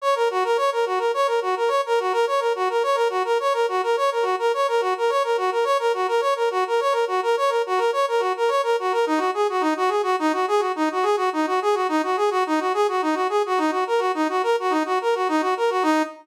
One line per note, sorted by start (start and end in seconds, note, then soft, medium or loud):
0.02 0.15 C#5 medium
0.15 0.28 A#4 medium
0.31 0.44 F#4 medium
0.44 0.57 A#4 medium
0.57 0.70 C#5 medium
0.72 0.85 A#4 medium
0.86 0.99 F#4 medium
0.98 1.11 A#4 medium
1.14 1.27 C#5 medium
1.27 1.40 A#4 medium
1.42 1.55 F#4 medium
1.56 1.70 A#4 medium
1.68 1.81 C#5 medium
1.86 1.99 A#4 medium
2.00 2.13 F#4 medium
2.12 2.25 A#4 medium
2.27 2.40 C#5 medium
2.40 2.53 A#4 medium
2.55 2.68 F#4 medium
2.70 2.83 A#4 medium
2.83 2.96 C#5 medium
2.95 3.08 A#4 medium
3.10 3.23 F#4 medium
3.25 3.38 A#4 medium
3.40 3.53 C#5 medium
3.53 3.66 A#4 medium
3.69 3.81 F#4 medium
3.83 3.96 A#4 medium
3.97 4.10 C#5 medium
4.11 4.24 A#4 medium
4.22 4.35 F#4 medium
4.39 4.52 A#4 medium
4.54 4.67 C#5 medium
4.68 4.81 A#4 medium
4.81 4.94 F#4 medium
4.98 5.10 A#4 medium
5.10 5.23 C#5 medium
5.24 5.37 A#4 medium
5.37 5.50 F#4 medium
5.52 5.65 A#4 medium
5.64 5.77 C#5 medium
5.79 5.92 A#4 medium
5.94 6.07 F#4 medium
6.08 6.21 A#4 medium
6.21 6.34 C#5 medium
6.36 6.49 A#4 medium
6.51 6.64 F#4 medium
6.67 6.80 A#4 medium
6.80 6.93 C#5 medium
6.92 7.05 A#4 medium
7.07 7.21 F#4 medium
7.23 7.36 A#4 medium
7.37 7.50 C#5 medium
7.49 7.62 A#4 medium
7.66 7.79 F#4 medium
7.78 7.91 A#4 medium
7.93 8.06 C#5 medium
8.08 8.21 A#4 medium
8.20 8.33 F#4 medium
8.37 8.50 A#4 medium
8.48 8.62 C#5 medium
8.63 8.76 A#4 medium
8.79 8.92 F#4 medium
8.92 9.05 A#4 medium
9.06 9.19 D#4 medium
9.18 9.31 F#4 medium
9.34 9.47 G#4 medium
9.49 9.62 F#4 medium
9.61 9.74 D#4 medium
9.77 9.90 F#4 medium
9.89 10.02 G#4 medium
10.03 10.16 F#4 medium
10.19 10.32 D#4 medium
10.33 10.46 F#4 medium
10.48 10.61 G#4 medium
10.59 10.72 F#4 medium
10.76 10.89 D#4 medium
10.92 11.05 F#4 medium
11.03 11.16 G#4 medium
11.17 11.29 F#4 medium
11.33 11.46 D#4 medium
11.47 11.60 F#4 medium
11.62 11.75 G#4 medium
11.74 11.87 F#4 medium
11.89 12.02 D#4 medium
12.03 12.16 F#4 medium
12.17 12.30 G#4 medium
12.31 12.44 F#4 medium
12.46 12.60 D#4 medium
12.60 12.73 F#4 medium
12.74 12.87 G#4 medium
12.88 13.01 F#4 medium
13.02 13.15 D#4 medium
13.14 13.27 F#4 medium
13.29 13.42 G#4 medium
13.46 13.59 F#4 medium
13.58 13.71 D#4 medium
13.71 13.84 F#4 medium
13.87 14.00 A#4 medium
13.99 14.12 F#4 medium
14.15 14.28 D#4 medium
14.29 14.42 F#4 medium
14.43 14.56 A#4 medium
14.60 14.73 F#4 medium
14.70 14.83 D#4 medium
14.85 14.99 F#4 medium
15.01 15.15 A#4 medium
15.15 15.28 F#4 medium
15.28 15.42 D#4 medium
15.41 15.54 F#4 medium
15.57 15.70 A#4 medium
15.70 15.83 F#4 medium
15.83 16.02 D#4 loud